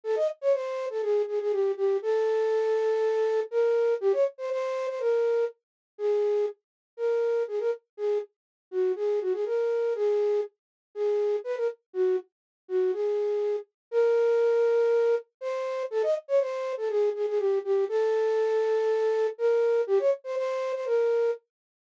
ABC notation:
X:1
M:4/4
L:1/16
Q:1/4=121
K:Bbdor
V:1 name="Flute"
=A e z d c3 A _A2 A A G2 G2 | =A12 B4 | G d z c c3 c B4 z4 | [K:C#dor] G4 z4 A4 G A z2 |
G2 z4 F2 G2 F G A4 | G4 z4 G4 B A z2 | F2 z4 F2 G6 z2 | [K:Bbdor] B12 c4 |
=A e z d c3 A _A2 A A G2 G2 | =A12 B4 | G d z c c3 c B4 z4 |]